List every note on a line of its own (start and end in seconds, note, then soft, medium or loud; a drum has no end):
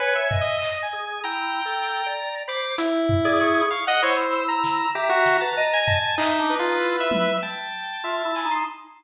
0.00 0.14 B4 medium
0.00 0.28 C#5 medium
0.00 0.37 G#5 medium
0.15 0.57 E5 medium
0.31 0.86 D#5 medium
0.31 floor tom loud
0.41 0.78 D#5 loud
0.62 clap medium
0.82 1.20 G#5 medium
0.93 1.21 G#4 medium
1.24 1.61 E4 medium
1.24 2.08 G5 loud
1.24 2.35 A#5 medium
1.65 2.02 A4 medium
1.86 closed hi-hat medium
2.06 2.43 D5 medium
2.48 2.76 C5 medium
2.48 2.61 B5 medium
2.48 2.77 D6 medium
2.78 3.62 E4 medium
2.78 closed hi-hat loud
3.09 floor tom loud
3.25 3.66 G#4 loud
3.25 3.39 D5 loud
3.41 3.68 C#6 medium
3.71 3.85 F5 medium
3.71 3.85 C#6 medium
3.87 4.02 D#5 loud
3.87 4.01 F#5 loud
4.02 4.86 E4 medium
4.02 4.44 C5 medium
4.02 4.17 C#5 medium
4.33 4.88 E6 medium
4.48 4.90 A#5 loud
4.64 snare medium
4.95 5.09 G4 medium
4.95 5.37 E5 medium
4.95 5.78 A#5 medium
5.09 5.37 F#4 loud
5.26 snare medium
5.41 5.55 B4 medium
5.41 5.69 A5 medium
5.57 5.99 D#5 loud
5.73 6.15 G#5 medium
5.87 6.15 A5 medium
5.87 floor tom loud
6.18 6.55 D#4 loud
6.18 6.37 E5 medium
6.18 clap loud
6.39 6.58 D4 medium
6.49 7.33 B4 medium
6.59 6.78 D#4 medium
6.59 6.97 F4 medium
6.80 7.36 E4 medium
7.00 7.38 E5 medium
7.11 high tom loud
7.42 7.98 G5 medium
7.42 8.54 A5 medium
8.04 8.22 F4 medium
8.04 8.32 E5 medium
8.25 8.43 E4 medium
8.35 8.49 G#5 medium
8.35 clap medium
8.45 8.64 D#4 loud
8.51 8.65 C6 medium